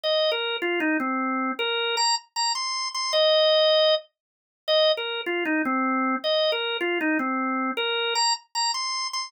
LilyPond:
\new Staff { \time 4/4 \key ees \major \tempo 4 = 155 ees''8. bes'8. f'8 ees'8 c'4. | bes'4 bes''8 r8 bes''8 c'''4 c'''8 | ees''2~ ees''8 r4. | ees''8. bes'8. f'8 ees'8 c'4. |
ees''8. bes'8. f'8 ees'8 c'4. | bes'4 bes''8 r8 bes''8 c'''4 c'''8 | }